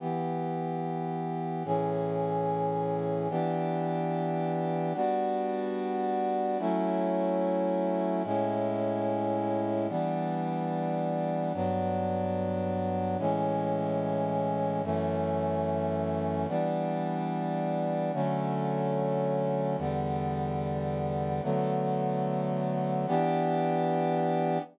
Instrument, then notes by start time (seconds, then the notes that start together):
brass section
0.00 E3 B3 G4
1.65 A2 E3 C#4 G#4
3.30 E3 B3 D4 G4
4.95 G3 B3 D4 F#4
6.59 F#3 A3 C#4 E4
8.24 A2 G#3 C#4 E4
9.89 E3 G3 B3 D4
11.54 G2 F#3 B3 D4
13.19 A2 E3 G#3 C#4
14.84 F#2 E3 A3 C#4
16.48 E3 G3 B3 D4
18.13 D3 F#3 A3 C#4
19.78 E2 D3 G3 B3
21.43 D3 F#3 A3 B3
23.08 E3 B3 D4 G4